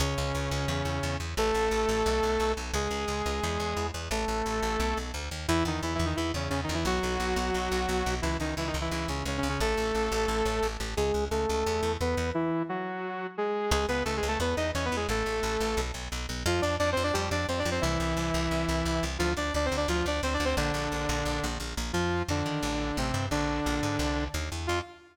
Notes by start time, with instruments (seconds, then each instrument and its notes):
0.00 electric bass (finger) C#2, lead 2 (sawtooth) C#3 C#4
0.18 electric bass (finger) C#2
0.35 electric bass (finger) C#2
0.51 electric bass (finger) C#2
0.68 electric bass (finger) E2
0.85 electric bass (finger) E2
1.03 electric bass (finger) E2
1.20 electric bass (finger) E2
1.37 electric bass (finger) A1, lead 2 (sawtooth) A3 A4
1.54 electric bass (finger) A1
1.71 electric bass (finger) A1
1.89 electric bass (finger) A1
2.06 electric bass (finger) B1
2.23 electric bass (finger) B1
2.40 electric bass (finger) B1
2.57 electric bass (finger) B1
2.73 electric bass (finger) C#2, lead 2 (sawtooth) G#3 G#4
2.91 electric bass (finger) C#2
3.08 electric bass (finger) C#2
3.26 electric bass (finger) C#2
3.43 electric bass (finger) E2
3.60 electric bass (finger) E2
3.77 electric bass (finger) E2
3.94 electric bass (finger) E2
4.11 electric bass (finger) A1, lead 2 (sawtooth) A3 A4
4.28 electric bass (finger) A1
4.46 electric bass (finger) A1
4.62 electric bass (finger) A1
4.80 electric bass (finger) B1
4.97 electric bass (finger) B1
5.14 electric bass (finger) D2
5.31 electric bass (finger) D#2
5.48 electric bass (finger) E2, lead 2 (sawtooth) E3 E4
5.65 electric bass (finger) E2, lead 2 (sawtooth) D#3 D#4
5.83 electric bass (finger) E2, lead 2 (sawtooth) E3 E4
5.95 lead 2 (sawtooth) E3 E4
5.99 electric bass (finger) E2
6.05 lead 2 (sawtooth) D#3 D#4
6.16 electric bass (finger) E2, lead 2 (sawtooth) E3 E4
6.34 electric bass (finger) E2, lead 2 (sawtooth) C#3 C#4
6.50 electric bass (finger) E2, lead 2 (sawtooth) C#3 C#4
6.64 lead 2 (sawtooth) D#3 D#4
6.69 electric bass (finger) E2
6.74 lead 2 (sawtooth) E3 E4
6.85 electric bass (finger) B1, lead 2 (sawtooth) F#3 F#4
7.03 electric bass (finger) B1
7.20 electric bass (finger) B1
7.36 electric bass (finger) B1
7.54 electric bass (finger) B1
7.72 electric bass (finger) B1
7.89 electric bass (finger) B1
8.06 electric bass (finger) B1
8.22 electric bass (finger) C#2, lead 2 (sawtooth) E3 E4
8.40 electric bass (finger) C#2, lead 2 (sawtooth) D#3 D#4
8.57 electric bass (finger) C#2, lead 2 (sawtooth) E3 E4
8.67 lead 2 (sawtooth) D#3 D#4
8.74 electric bass (finger) C#2
8.81 lead 2 (sawtooth) E3 E4
8.91 electric bass (finger) C#2, lead 2 (sawtooth) E3 E4
9.08 electric bass (finger) C#2, lead 2 (sawtooth) C#3 C#4
9.25 electric bass (finger) C#2, lead 2 (sawtooth) C#3 C#4
9.38 lead 2 (sawtooth) C#3 C#4
9.43 electric bass (finger) C#2
9.49 lead 2 (sawtooth) C#3 C#4
9.60 electric bass (finger) A1, lead 2 (sawtooth) A3 A4
9.77 electric bass (finger) A1
9.95 electric bass (finger) A1
10.12 electric bass (finger) A1
10.28 electric bass (finger) A1
10.45 electric bass (finger) A1
10.63 electric bass (finger) A1
10.80 electric bass (finger) A1
10.97 electric bass (finger) C#2, lead 2 (sawtooth) G#3 G#4
11.14 electric bass (finger) C#2
11.31 electric bass (finger) C#2, lead 2 (sawtooth) A3 A4
11.49 electric bass (finger) C#2
11.66 electric bass (finger) E2
11.83 electric bass (finger) E2
12.01 electric bass (finger) E2, lead 2 (sawtooth) B3 B4
12.17 electric bass (finger) E2
12.34 lead 2 (sawtooth) E3 E4
12.69 lead 2 (sawtooth) F#3 F#4
13.38 lead 2 (sawtooth) G#3 G#4
13.71 electric bass (finger) C#2, lead 2 (sawtooth) G#3 G#4
13.88 electric bass (finger) C#2, lead 2 (sawtooth) B3 B4
14.05 electric bass (finger) C#2, lead 2 (sawtooth) A3 A4
14.17 lead 2 (sawtooth) G#3 G#4
14.23 electric bass (finger) C#2
14.28 lead 2 (sawtooth) A3 A4
14.40 electric bass (finger) E2, lead 2 (sawtooth) B3 B4
14.57 electric bass (finger) E2, lead 2 (sawtooth) D#4 D#5
14.75 electric bass (finger) E2, lead 2 (sawtooth) C#4 C#5
14.85 lead 2 (sawtooth) B3 B4
14.92 electric bass (finger) E2
14.96 lead 2 (sawtooth) G#3 G#4
15.09 electric bass (finger) A1, lead 2 (sawtooth) A3 A4
15.26 electric bass (finger) A1
15.43 electric bass (finger) A1
15.60 electric bass (finger) A1
15.77 electric bass (finger) B1
15.94 electric bass (finger) B1
16.12 electric bass (finger) B1
16.29 electric bass (finger) B1
16.46 electric bass (finger) F2, lead 2 (sawtooth) F3 F4
16.62 electric bass (finger) F2, lead 2 (sawtooth) D4 D5
16.79 electric bass (finger) F2, lead 2 (sawtooth) D4 D5
16.92 lead 2 (sawtooth) C4 C5
16.97 electric bass (finger) F2
17.03 lead 2 (sawtooth) D4 D5
17.13 electric bass (finger) F2, lead 2 (sawtooth) G3 G4
17.31 electric bass (finger) F2, lead 2 (sawtooth) D4 D5
17.48 electric bass (finger) F2, lead 2 (sawtooth) C4 C5
17.59 lead 2 (sawtooth) D4 D5
17.65 electric bass (finger) F2
17.71 lead 2 (sawtooth) C4 C5
17.81 electric bass (finger) C2, lead 2 (sawtooth) E3 E4
18.00 electric bass (finger) C2
18.17 electric bass (finger) C2
18.34 electric bass (finger) C2
18.51 electric bass (finger) C2
18.69 electric bass (finger) C2
18.85 electric bass (finger) C2
19.03 electric bass (finger) C2
19.19 electric bass (finger) D2, lead 2 (sawtooth) F3 F4
19.37 electric bass (finger) D2, lead 2 (sawtooth) D4 D5
19.54 electric bass (finger) D2, lead 2 (sawtooth) D4 D5
19.66 lead 2 (sawtooth) C4 C5
19.72 electric bass (finger) D2
19.77 lead 2 (sawtooth) D4 D5
19.88 electric bass (finger) D2, lead 2 (sawtooth) F3 F4
20.06 electric bass (finger) D2, lead 2 (sawtooth) D4 D5
20.23 electric bass (finger) D2, lead 2 (sawtooth) C4 C5
20.34 lead 2 (sawtooth) D4 D5
20.40 electric bass (finger) D2
20.45 lead 2 (sawtooth) C4 C5
20.57 electric bass (finger) A#1, lead 2 (sawtooth) D3 D4
20.74 electric bass (finger) A#1
20.92 electric bass (finger) A#1
21.09 electric bass (finger) A#1
21.25 electric bass (finger) A#1
21.44 electric bass (finger) A#1
21.60 electric bass (finger) A#1
21.77 electric bass (finger) A#1
21.93 electric bass (finger) F2, lead 2 (sawtooth) F3 F4
22.28 electric bass (finger) F2, lead 2 (sawtooth) D3 D4
22.46 electric bass (finger) D#3
22.63 electric bass (finger) A1
22.97 electric bass (finger) A1, lead 2 (sawtooth) C3 C4
23.14 electric bass (finger) G2
23.31 electric bass (finger) A#1, lead 2 (sawtooth) D3 D4
23.66 electric bass (finger) A#1
23.83 electric bass (finger) G#2
23.99 electric bass (finger) C2
24.34 electric bass (finger) D#2
24.52 electric bass (finger) E2
24.67 electric bass (finger) F2, lead 2 (sawtooth) F4